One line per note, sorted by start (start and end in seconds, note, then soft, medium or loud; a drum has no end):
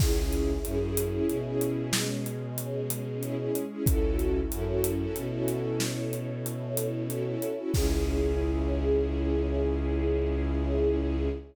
0.00 0.55 C#2 medium
0.00 1.91 C#4 medium
0.00 0.52 C#4 loud
0.00 1.91 E4 medium
0.00 0.52 E4 loud
0.00 1.91 G#4 medium
0.00 0.52 G#4 loud
0.00 kick loud
0.00 crash loud
0.33 closed hi-hat medium
0.65 1.19 F#2 medium
0.65 0.78 C#4 medium
0.65 0.78 E4 loud
0.65 0.78 G#4 medium
0.65 closed hi-hat medium
0.81 1.07 C#4 loud
0.81 1.07 E4 medium
0.81 1.07 G#4 medium
0.97 closed hi-hat loud
1.14 1.39 C#4 medium
1.14 1.39 E4 loud
1.14 1.39 G#4 medium
1.29 3.48 B2 medium
1.29 closed hi-hat medium
1.45 1.97 C#4 medium
1.45 1.97 E4 medium
1.45 1.97 G#4 medium
1.61 closed hi-hat medium
1.93 3.84 G#3 medium
1.93 3.84 C#4 medium
1.93 3.84 G#4 medium
1.93 snare loud
2.26 closed hi-hat medium
2.58 closed hi-hat loud
2.90 closed hi-hat loud
3.23 3.35 C#4 loud
3.23 3.35 E4 loud
3.23 3.35 G#4 medium
3.23 closed hi-hat medium
3.39 3.65 C#4 medium
3.39 3.65 E4 medium
3.39 3.65 G#4 medium
3.55 closed hi-hat medium
3.71 3.84 C#4 loud
3.71 3.84 E4 medium
3.71 3.84 G#4 medium
3.86 4.42 C#2 medium
3.86 5.78 C#4 medium
3.86 4.39 C#4 loud
3.86 5.78 E4 medium
3.86 4.39 E4 loud
3.86 5.78 F#4 medium
3.86 4.39 F#4 loud
3.86 5.78 A4 medium
3.86 4.39 A4 loud
3.86 kick loud
3.86 closed hi-hat loud
4.19 closed hi-hat medium
4.51 5.06 F#2 medium
4.51 4.64 C#4 medium
4.51 4.64 E4 loud
4.51 4.64 F#4 medium
4.51 4.64 A4 medium
4.51 closed hi-hat loud
4.67 4.93 C#4 medium
4.67 4.93 E4 medium
4.67 4.93 F#4 medium
4.67 4.93 A4 medium
4.84 closed hi-hat loud
5.00 5.26 C#4 medium
5.00 5.26 E4 medium
5.00 5.26 F#4 medium
5.00 5.26 A4 medium
5.16 7.35 B2 medium
5.16 closed hi-hat medium
5.32 5.84 C#4 medium
5.32 5.84 E4 medium
5.32 5.84 F#4 medium
5.32 5.84 A4 medium
5.48 closed hi-hat medium
5.80 7.72 C#4 medium
5.80 7.72 E4 medium
5.80 7.72 A4 medium
5.80 7.72 C#5 medium
5.80 snare loud
6.13 closed hi-hat medium
6.46 closed hi-hat loud
6.77 closed hi-hat loud
7.10 7.23 C#4 medium
7.10 7.23 E4 medium
7.10 7.23 F#4 medium
7.10 7.23 A4 medium
7.10 closed hi-hat medium
7.26 7.52 C#4 medium
7.26 7.52 E4 medium
7.26 7.52 F#4 medium
7.26 7.52 A4 medium
7.42 closed hi-hat medium
7.58 7.71 C#4 medium
7.58 7.71 E4 medium
7.58 7.71 F#4 medium
7.58 7.71 A4 medium
7.74 11.28 C#2 loud
7.74 11.28 C#4 medium
7.74 11.29 C#4 loud
7.74 11.28 E4 medium
7.74 11.29 E4 loud
7.74 11.28 G#4 loud
7.74 11.29 G#4 loud
7.74 kick loud
7.74 crash loud